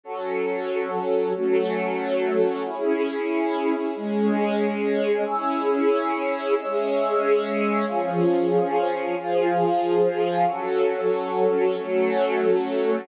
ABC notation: X:1
M:3/4
L:1/8
Q:1/4=69
K:C#m
V:1 name="String Ensemble 1"
[F,CA]3 [F,A,A]3 | [CEG]3 [G,CG]3 | [CEG]3 [G,CG]3 | [^E,CG]3 [E,^EG]3 |
[F,CA]3 [F,A,A]3 |]
V:2 name="Pad 5 (bowed)"
[FAc]3 [CFc]3 | [CEG]3 [G,CG]3 | [cge']3 [cee']3 | [^Ecg]3 [E^eg]3 |
[FAc]3 [CFc]3 |]